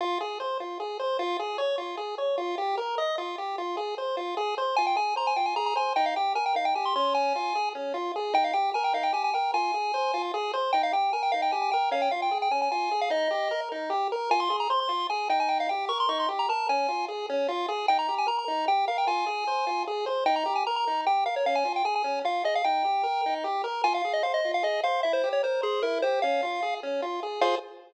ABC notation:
X:1
M:3/4
L:1/16
Q:1/4=151
K:Fm
V:1 name="Lead 1 (square)"
z12 | z12 | z12 | z12 |
a g a2 b a g a b b a2 | g f g2 a g f g a c' c'2 | a6 z6 | g f g2 a g f g a a g2 |
a8 z4 | g f g2 a g f g a a g2 | f g f g2 g a a a3 f | e6 z6 |
a c'2 b c' c'3 a2 g a | g f g2 d' c' d' c' z b =a2 | a4 z8 | g b2 a b b3 g2 f g |
a8 z4 | g b2 a b b3 g2 f d | f a2 g a a3 f2 e f | g8 z4 |
a f2 e f e2 f e2 f2 | =e c2 d c2 A2 B2 c2 | f6 z6 | f4 z8 |]
V:2 name="Lead 1 (square)"
F2 A2 c2 F2 A2 c2 | F2 A2 d2 F2 A2 d2 | F2 G2 B2 e2 F2 G2 | F2 A2 c2 F2 A2 c2 |
F2 A2 c2 F2 A2 c2 | E2 G2 B2 E2 G2 D2- | D2 F2 A2 D2 F2 A2 | E2 G2 B2 E2 G2 B2 |
F2 A2 c2 F2 A2 c2 | E2 G2 B2 E2 G2 B2 | D2 F2 A2 D2 F2 A2 | E2 G2 B2 E2 G2 B2 |
F2 A2 c2 F2 A2 E2- | E2 G2 B2 E2 G2 B2 | D2 F2 A2 D2 F2 A2 | E2 G2 B2 E2 G2 B2 |
F2 A2 c2 F2 A2 c2 | E2 G2 B2 E2 G2 B2 | D2 F2 A2 D2 F2 A2 | E2 G2 B2 E2 G2 B2 |
F2 A2 c2 F2 A2 c2 | =E2 G2 B2 c2 E2 G2 | D2 F2 A2 D2 F2 A2 | [FAc]4 z8 |]